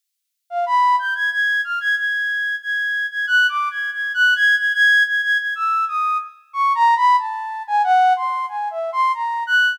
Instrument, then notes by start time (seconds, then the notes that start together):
flute
0.50 F5
0.66 B5
0.99 G6
1.15 G#6
1.32 G#6
1.64 F6
1.80 G#6
1.97 G#6
2.62 G#6
3.11 G#6
3.27 F#6
3.49 D6
3.71 G#6
3.93 G#6
4.14 F#6
4.36 G#6
4.57 G#6
4.74 G#6
5.07 G#6
5.23 G#6
5.39 G#6
5.55 E6
5.88 D#6
6.53 C#6
6.75 A#5
6.97 B5
7.18 A5
7.67 G#5
7.84 F#5
8.16 C6
8.49 G#5
8.71 E5
8.92 C6
9.14 A#5
9.47 F#6